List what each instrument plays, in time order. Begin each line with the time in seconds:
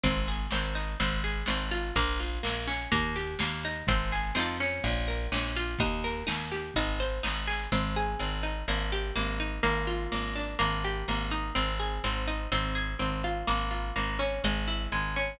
0.04 electric bass (finger) G#1, pizzicato strings C4, kick, snare
0.27 pizzicato strings G#4, snare
0.51 electric bass (finger) G#1, pizzicato strings C4, snare
0.75 pizzicato strings D#4, snare
1.00 electric bass (finger) G#1, pizzicato strings C4, kick, snare
1.24 pizzicato strings G#4, snare
1.46 electric bass (finger) G#1, pizzicato strings C4, snare
1.71 pizzicato strings F4, snare
1.96 electric bass (finger) A#1, pizzicato strings A#3, kick, snare
2.20 pizzicato strings F4, snare
2.43 electric bass (finger) A#1, pizzicato strings A#3, snare
2.68 pizzicato strings C#4, snare
2.92 electric bass (finger) D#2, pizzicato strings A#3, kick, snare
3.16 pizzicato strings G4, snare
3.39 electric bass (finger) D#2, pizzicato strings A#3, snare
3.63 pizzicato strings D#4, snare
3.87 electric bass (finger) G#1, pizzicato strings C4, kick, snare
4.12 pizzicato strings G#4, snare
4.35 electric bass (finger) F2, pizzicato strings C4 D#4 F4, snare
4.40 pizzicato strings A4
4.59 pizzicato strings C#4, snare
4.84 electric bass (finger) A#1, kick, snare
5.07 pizzicato strings A#4, snare
5.32 electric bass (finger) A#1, pizzicato strings C#4, snare
5.55 pizzicato strings F4, snare
5.79 electric bass (finger) D#2, pizzicato strings D#4, kick, snare
6.04 pizzicato strings A#4, snare
6.27 electric bass (finger) D#2, pizzicato strings D#4, snare
6.52 pizzicato strings G4, snare
6.74 electric bass (finger) G#1, pizzicato strings D#4, kick, snare
7.00 pizzicato strings C5, snare
7.23 electric bass (finger) G#1, pizzicato strings D#4, snare
7.47 pizzicato strings G#4, snare
7.72 electric bass (finger) G#1, pizzicato strings C4
7.96 pizzicato strings G#4
8.20 electric bass (finger) G#1, pizzicato strings C4
8.43 pizzicato strings D#4
8.68 electric bass (finger) G#1, pizzicato strings A#3
8.92 pizzicato strings G4
9.16 electric bass (finger) G#1, pizzicato strings A#3
9.40 pizzicato strings D#4
9.63 electric bass (finger) G#1, pizzicato strings A#3
9.87 pizzicato strings F4
10.12 electric bass (finger) G#1, pizzicato strings A#3
10.36 pizzicato strings D4
10.59 electric bass (finger) G#1, pizzicato strings A#3
10.85 pizzicato strings G4
11.08 electric bass (finger) G#1, pizzicato strings A#3
11.31 pizzicato strings D#4
11.55 electric bass (finger) G#1, pizzicato strings C4
11.80 pizzicato strings G#4
12.04 electric bass (finger) G#1, pizzicato strings C4
12.28 pizzicato strings D#4
12.52 electric bass (finger) G#1, pizzicato strings C4
12.75 pizzicato strings G#4
12.99 electric bass (finger) G#1, pizzicato strings C4
13.24 pizzicato strings F4
13.47 electric bass (finger) G#1, pizzicato strings A#3
13.71 pizzicato strings F4
13.96 electric bass (finger) G#1, pizzicato strings A#3
14.19 pizzicato strings C#4
14.44 electric bass (finger) G#1, pizzicato strings G#3
14.68 pizzicato strings E4
14.92 electric bass (finger) G#1, pizzicato strings G#3
15.16 pizzicato strings C#4